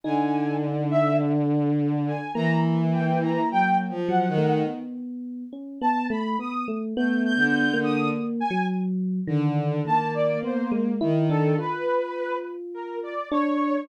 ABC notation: X:1
M:2/4
L:1/16
Q:1/4=52
K:none
V:1 name="Violin"
D,8 | E,4 (3_G,2 F,2 _E,2 | z8 | (3A,2 D,2 D,2 z4 |
D,2 _B,4 _E,2 | z8 |]
V:2 name="Lead 2 (sawtooth)"
_a2 z e z3 a | _b z g b g z _g2 | z4 a b _e' z | g' g'2 _e' z _a z2 |
z2 a d c z2 A | B3 z _B d _d2 |]
V:3 name="Electric Piano 1"
_E4 D4 | _B,6 _G, A, | B,3 _D B, A, B, A, | (3B,4 _B,4 _G,4 |
_E,2 E,2 B, _A, =E D | F6 D2 |]